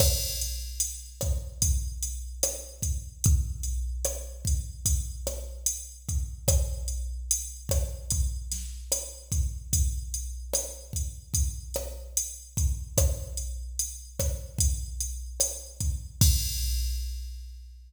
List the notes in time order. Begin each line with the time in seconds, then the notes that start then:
0.00 kick, cross-stick, crash
0.41 closed hi-hat
0.80 closed hi-hat
1.21 kick, cross-stick, closed hi-hat
1.62 kick, closed hi-hat
2.03 closed hi-hat
2.43 cross-stick, closed hi-hat
2.82 kick, closed hi-hat
3.24 kick, closed hi-hat
3.63 closed hi-hat
4.05 cross-stick, closed hi-hat
4.45 kick, closed hi-hat
4.86 kick, closed hi-hat
5.27 cross-stick, closed hi-hat
5.66 closed hi-hat
6.09 kick, closed hi-hat
6.48 kick, cross-stick, closed hi-hat
6.88 closed hi-hat
7.31 closed hi-hat
7.69 kick, cross-stick, closed hi-hat
8.10 kick, closed hi-hat
8.52 snare, closed hi-hat
8.92 cross-stick, closed hi-hat
9.32 kick, closed hi-hat
9.73 kick, closed hi-hat
10.14 closed hi-hat
10.54 cross-stick, closed hi-hat
10.93 kick, closed hi-hat
11.34 kick, closed hi-hat
11.74 cross-stick, closed hi-hat
12.17 closed hi-hat
12.57 kick, closed hi-hat
12.98 kick, cross-stick, closed hi-hat
13.37 closed hi-hat
13.79 closed hi-hat
14.19 kick, cross-stick, closed hi-hat
14.58 kick, closed hi-hat
15.01 closed hi-hat
15.40 cross-stick, closed hi-hat
15.80 kick, closed hi-hat
16.21 kick, crash